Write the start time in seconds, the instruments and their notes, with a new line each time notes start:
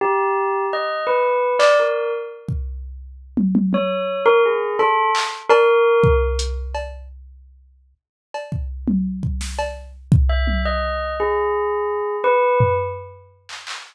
0.01 tubular bells G4
0.73 tubular bells D#5
1.07 tubular bells B4
1.59 tubular bells D5, clap
1.80 tubular bells A#4
2.49 kick
3.37 high tom
3.55 high tom
3.73 tubular bells C#5, high tom
4.26 tubular bells A#4
4.45 tubular bells G#4
4.79 tubular bells A4, cowbell
5.15 clap
5.49 tubular bells A#4, cowbell
6.04 kick
6.39 closed hi-hat
6.75 cowbell
8.34 cowbell
8.52 kick
8.88 high tom
9.23 kick
9.41 snare
9.59 cowbell
10.12 kick
10.29 tubular bells E5
10.47 high tom
10.65 tubular bells D#5
11.20 tubular bells G#4
12.24 tubular bells B4
12.60 floor tom
13.49 clap
13.67 clap